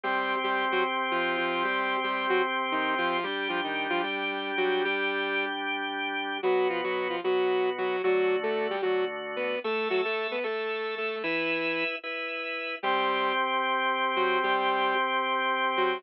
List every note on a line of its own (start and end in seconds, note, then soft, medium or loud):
0.04 3.17 C3 medium
0.04 0.36 G3 medium
0.04 3.17 C4 medium
0.04 3.17 G4 medium
0.04 0.36 G4 loud
0.44 0.65 G3 medium
0.44 0.65 G4 medium
0.72 0.84 F#3 medium
0.72 0.84 F#4 loud
1.11 1.37 F3 medium
1.11 1.37 F4 medium
1.37 1.63 F3 medium
1.37 1.63 F4 medium
1.64 1.97 G3 medium
1.64 1.97 G4 loud
2.04 2.26 G3 medium
2.04 2.26 G4 medium
2.29 2.42 F#3 medium
2.29 2.42 F#4 loud
2.72 2.94 D#3 medium
2.72 2.94 D#4 medium
2.98 3.24 F3 medium
2.98 3.24 F4 loud
3.23 3.48 G3 medium
3.23 6.38 G3 medium
3.23 6.38 D4 medium
3.23 3.48 G4 loud
3.23 6.38 G4 medium
3.49 3.61 F3 medium
3.49 3.61 F4 medium
3.64 3.87 D#3 medium
3.64 3.87 D#4 medium
3.90 4.02 F3 medium
3.90 4.02 F4 loud
4.03 4.52 G3 medium
4.03 4.52 G4 medium
4.57 4.83 F#3 medium
4.57 4.83 F#4 loud
4.85 5.45 G3 loud
4.85 5.45 G4 loud
6.43 7.16 B2 medium
6.43 6.68 F#3 loud
6.43 7.16 B3 medium
6.43 6.68 F#4 loud
6.43 7.16 F#4 medium
6.70 6.81 F3 medium
6.70 6.81 F4 medium
6.84 7.08 F#3 medium
6.84 7.08 F#4 loud
7.10 7.21 F3 medium
7.10 7.21 F4 medium
7.24 7.96 B2 medium
7.24 7.70 F#3 medium
7.24 7.96 B3 medium
7.24 7.70 F#4 medium
7.24 7.96 F#4 medium
7.78 8.02 F#3 medium
7.78 8.02 F#4 loud
8.04 8.76 D3 medium
8.04 8.36 F#3 loud
8.04 8.76 A3 medium
8.04 8.76 F#4 medium
8.04 8.36 F#4 loud
8.43 8.67 A3 medium
8.43 8.67 A4 loud
8.70 8.81 G3 medium
8.70 8.81 G4 medium
8.82 9.56 D3 medium
8.82 9.05 F#3 medium
8.82 9.56 A3 medium
8.82 9.05 F#4 medium
8.82 9.56 F#4 medium
9.36 9.59 B3 medium
9.36 9.59 B4 medium
9.64 10.36 A3 medium
9.64 9.88 A3 medium
9.64 10.36 A4 medium
9.64 9.88 A4 loud
9.64 10.36 E5 medium
9.90 10.01 F#3 medium
9.90 10.01 F#4 loud
10.05 10.27 A3 medium
10.05 10.27 A4 loud
10.31 10.44 B3 medium
10.31 10.44 B4 medium
10.44 11.16 A3 medium
10.44 10.95 A3 medium
10.44 11.16 A4 medium
10.44 10.95 A4 medium
10.44 11.16 E5 medium
10.98 11.23 A3 medium
10.98 11.23 A4 medium
11.23 11.84 E3 loud
11.23 11.84 E4 loud
11.23 11.96 E4 medium
11.23 11.96 B4 medium
11.23 11.96 E5 loud
12.04 12.76 E4 medium
12.04 12.76 B4 medium
12.04 12.76 E5 medium
12.83 15.98 C3 loud
12.83 13.33 G3 loud
12.83 15.98 C4 medium
12.83 13.33 G4 loud
12.83 15.98 G4 medium
14.16 14.39 F#3 medium
14.16 14.39 F#4 loud
14.43 14.94 G3 loud
14.43 14.94 G4 loud
15.77 16.03 F#3 medium
15.77 16.03 F#4 loud